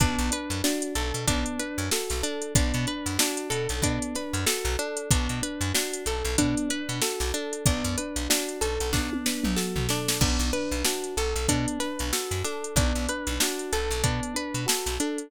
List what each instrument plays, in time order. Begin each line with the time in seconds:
0.00 electric bass (finger) B1, electric piano 1 B3, acoustic guitar (steel) D4, kick, closed hi-hat
0.18 electric bass (finger) B1, closed hi-hat
0.31 electric piano 1 D4, acoustic guitar (steel) B4, closed hi-hat
0.50 electric bass (finger) F#2, closed hi-hat
0.64 acoustic guitar (steel) D4, electric piano 1 F#4, snare
0.82 closed hi-hat
0.95 electric bass (finger) B1, acoustic guitar (steel) A4, electric piano 1 A4, closed hi-hat
1.14 electric bass (finger) B2, closed hi-hat
1.27 electric bass (finger) B1, electric piano 1 B3, acoustic guitar (steel) D4, kick, closed hi-hat
1.46 closed hi-hat
1.59 electric piano 1 D4, acoustic guitar (steel) B4, closed hi-hat
1.78 electric bass (finger) F#2, closed hi-hat
1.91 electric piano 1 F#4, acoustic guitar (steel) A4, snare
2.10 electric bass (finger) B1, snare, closed hi-hat
2.23 acoustic guitar (steel) D4, electric piano 1 A4, closed hi-hat
2.42 closed hi-hat
2.55 electric bass (finger) B1, electric piano 1 B3, acoustic guitar (steel) D4, kick, closed hi-hat
2.74 electric bass (finger) B2, closed hi-hat
2.87 electric piano 1 D4, acoustic guitar (steel) B4, closed hi-hat
3.06 electric bass (finger) F#2, snare, closed hi-hat
3.18 acoustic guitar (steel) D4, electric piano 1 F#4, snare
3.37 closed hi-hat
3.50 electric bass (finger) B2, acoustic guitar (steel) A4, electric piano 1 A4, closed hi-hat
3.69 electric bass (finger) B1, closed hi-hat
3.82 electric bass (finger) B2, electric piano 1 B3, acoustic guitar (steel) D4, kick, closed hi-hat
4.02 closed hi-hat
4.15 electric piano 1 D4, acoustic guitar (steel) B4, snare, closed hi-hat
4.33 electric bass (finger) F#2, closed hi-hat
4.46 electric piano 1 F#4, acoustic guitar (steel) A4, snare
4.65 electric bass (finger) B1, snare, closed hi-hat
4.79 acoustic guitar (steel) D4, electric piano 1 A4, closed hi-hat
4.97 closed hi-hat
5.11 electric bass (finger) B1, electric piano 1 B3, acoustic guitar (steel) D4, kick, closed hi-hat
5.29 electric bass (finger) B2, closed hi-hat
5.42 electric piano 1 D4, acoustic guitar (steel) B4, closed hi-hat
5.61 electric bass (finger) F#2, closed hi-hat
5.74 acoustic guitar (steel) D4, electric piano 1 F#4, snare
5.93 closed hi-hat
6.06 electric bass (finger) B1, electric piano 1 A4, acoustic guitar (steel) A4, closed hi-hat
6.25 electric bass (finger) B1, closed hi-hat
6.38 electric bass (finger) B2, electric piano 1 B3, acoustic guitar (steel) D4, kick, closed hi-hat
6.57 closed hi-hat
6.69 electric piano 1 D4, acoustic guitar (steel) B4, closed hi-hat
6.89 electric bass (finger) B2, closed hi-hat
7.02 electric piano 1 F#4, acoustic guitar (steel) A4, snare
7.20 electric bass (finger) B1, snare, closed hi-hat
7.34 acoustic guitar (steel) D4, electric piano 1 A4, closed hi-hat
7.53 closed hi-hat
7.66 electric bass (finger) B1, electric piano 1 B3, acoustic guitar (steel) D4, kick, closed hi-hat
7.84 electric bass (finger) F#2, closed hi-hat
7.97 electric piano 1 D4, acoustic guitar (steel) B4, closed hi-hat
8.16 electric bass (finger) B1, closed hi-hat
8.29 acoustic guitar (steel) D4, electric piano 1 F#4, snare
8.49 closed hi-hat
8.61 electric bass (finger) B1, acoustic guitar (steel) A4, electric piano 1 A4, closed hi-hat
8.80 electric bass (finger) B1, closed hi-hat
8.93 electric bass (finger) B1, electric piano 1 B3, acoustic guitar (steel) D4, kick, snare
9.13 high tom
9.26 electric piano 1 D4, acoustic guitar (steel) B4, snare
9.44 electric bass (finger) B1, mid tom
9.56 electric piano 1 F#4, acoustic guitar (steel) A4, snare
9.76 electric bass (finger) B1, floor tom
9.89 acoustic guitar (steel) D4, electric piano 1 A4, snare
10.08 snare
10.21 electric bass (finger) B1, electric piano 1 B3, acoustic guitar (steel) D4, kick, crash
10.39 electric bass (finger) B1, snare, closed hi-hat
10.53 electric piano 1 D4, acoustic guitar (steel) B4, closed hi-hat
10.71 electric bass (finger) B1, closed hi-hat
10.85 acoustic guitar (steel) D4, electric piano 1 F#4, snare
11.04 closed hi-hat
11.17 electric bass (finger) B1, electric piano 1 A4, acoustic guitar (steel) A4, closed hi-hat
11.36 electric bass (finger) B1, closed hi-hat
11.48 electric bass (finger) B2, electric piano 1 B3, acoustic guitar (steel) D4, kick, closed hi-hat
11.68 closed hi-hat
11.79 electric piano 1 D4, acoustic guitar (steel) B4, snare, closed hi-hat
11.99 electric bass (finger) B1, closed hi-hat
12.13 electric piano 1 F#4, acoustic guitar (steel) A4, snare
12.31 electric bass (finger) F#2, snare, closed hi-hat
12.44 acoustic guitar (steel) D4, electric piano 1 A4, snare, closed hi-hat
12.64 closed hi-hat
12.76 electric bass (finger) B1, electric piano 1 B3, acoustic guitar (steel) D4, kick, closed hi-hat
12.95 electric bass (finger) B1, closed hi-hat
13.08 electric piano 1 D4, acoustic guitar (steel) B4, closed hi-hat
13.27 electric bass (finger) B1, closed hi-hat
13.40 acoustic guitar (steel) D4, electric piano 1 F#4, snare
13.59 closed hi-hat
13.73 electric bass (finger) B1, acoustic guitar (steel) A4, electric piano 1 A4, closed hi-hat
13.91 electric bass (finger) B1, closed hi-hat
14.03 electric bass (finger) B2, electric piano 1 B3, acoustic guitar (steel) D4, kick, closed hi-hat
14.23 closed hi-hat
14.34 electric piano 1 D4, acoustic guitar (steel) B4, closed hi-hat
14.54 electric bass (finger) B2, closed hi-hat
14.66 electric piano 1 F#4, acoustic guitar (steel) A4, snare
14.86 electric bass (finger) B1, snare, closed hi-hat
15.00 acoustic guitar (steel) D4, electric piano 1 A4, closed hi-hat
15.18 closed hi-hat